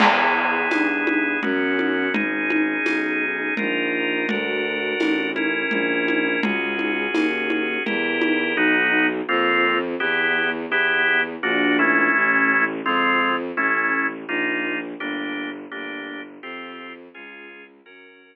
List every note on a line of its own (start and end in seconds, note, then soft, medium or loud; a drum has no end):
0.00 0.65 E2 medium
0.00 1.40 B3 medium
0.00 1.40 E4 medium
0.00 1.40 G#4 medium
0.00 crash loud
0.00 low conga loud
0.71 1.37 G2 medium
0.71 tambourine medium
0.71 high conga medium
1.07 high conga medium
1.43 2.08 F#2 loud
1.43 2.13 B3 medium
1.43 2.13 C#4 medium
1.43 2.13 F#4 medium
1.43 low conga medium
1.79 high conga medium
2.12 2.77 G#1 medium
2.12 3.54 C#4 medium
2.12 3.54 D#4 medium
2.12 3.54 G#4 medium
2.12 low conga loud
2.50 high conga medium
2.85 3.50 B1 medium
2.85 tambourine medium
2.85 high conga medium
3.57 4.24 A#1 medium
3.57 4.27 D#4 medium
3.57 4.27 F4 medium
3.57 4.27 A#4 medium
3.57 low conga medium
4.29 4.94 D2 medium
4.29 5.30 D4 medium
4.29 5.30 F#4 medium
4.29 5.30 A#4 medium
4.29 low conga loud
4.99 5.63 A1 medium
4.99 tambourine medium
4.99 high conga medium
5.36 6.41 C#4 medium
5.36 6.41 E4 medium
5.36 6.41 A#4 medium
5.36 high conga medium
5.71 6.36 A#1 medium
5.71 low conga medium
6.08 high conga medium
6.42 7.07 C#2 medium
6.42 7.83 C#4 medium
6.42 7.83 F#4 medium
6.42 7.83 G#4 medium
6.42 low conga loud
6.79 high conga medium
7.13 7.77 D#2 medium
7.13 tambourine medium
7.13 high conga loud
7.50 high conga medium
7.86 8.53 E2 medium
7.86 8.56 E4 medium
7.86 8.56 G4 medium
7.86 8.56 A#4 medium
7.86 low conga medium
8.22 high conga medium
8.55 9.21 B1 loud
8.55 9.07 B3 loud
8.55 9.07 D#4 loud
8.55 9.07 F#4 loud
9.29 9.95 F2 loud
9.29 9.79 A#3 loud
9.29 9.79 C4 loud
9.29 9.79 F4 loud
10.00 10.66 E2 loud
10.00 10.50 B3 loud
10.00 10.50 E4 medium
10.00 10.50 G4 loud
10.69 11.35 E2 medium
10.69 11.22 B3 loud
10.69 11.22 E4 loud
10.69 11.22 G4 loud
11.43 12.09 A#1 loud
11.43 11.77 A#3 loud
11.43 11.77 D4 loud
11.43 11.77 F#4 loud
11.79 12.65 A3 loud
11.79 12.65 C#4 loud
11.79 12.65 E4 loud
12.15 12.81 A1 loud
12.86 13.51 F2 loud
12.86 13.36 G#3 loud
12.86 13.36 C4 loud
12.86 13.36 F4 loud
13.57 14.24 A1 medium
13.57 14.07 A3 loud
13.57 14.07 C#4 loud
13.57 14.07 E4 loud
14.28 14.94 A#1 loud
14.28 14.79 A#3 loud
14.28 14.79 D#4 loud
14.28 14.79 F4 loud
15.00 15.66 G1 loud
15.00 15.50 A#3 loud
15.00 15.50 D4 loud
15.00 15.50 G4 loud
15.71 16.38 G1 medium
15.71 16.21 A#3 loud
15.71 16.21 D4 loud
15.71 16.21 G4 loud
16.43 17.08 F2 loud
16.43 16.93 C4 loud
16.43 16.93 F4 loud
16.43 16.93 G4 loud
17.14 17.81 C#2 loud
17.14 17.64 C#4 loud
17.14 17.64 F4 loud
17.14 17.64 G#4 loud
17.86 18.36 F#2 medium
17.86 18.36 C#4 loud
17.86 18.36 F#4 loud
17.86 18.36 A#4 loud